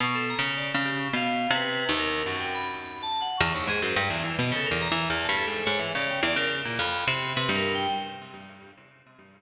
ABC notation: X:1
M:2/4
L:1/16
Q:1/4=106
K:none
V:1 name="Orchestral Harp" clef=bass
(3B,,4 ^C,4 C,4 | (3B,,4 C,4 ^D,,4 | ^F,,8 | E,, ^D,, ^G,, ^F,, =G,, E,, E, B,, |
(3^C,2 E,,2 E,2 (3E,,2 G,,2 ^G,,2 | ^G,, E, ^C,2 E,, C,2 ^A,, | F,,2 C,2 C, G,,3 |]
V:2 name="Electric Piano 2"
^c' A ^a z d z G c' | f3 B3 ^A2 | ^c' g b z (3b2 a2 ^f2 | ^c'2 ^G =c d2 z ^d |
A ^A ^a2 z =a =A2 | ^c B d g d ^A z2 | b4 (3B2 ^A2 g2 |]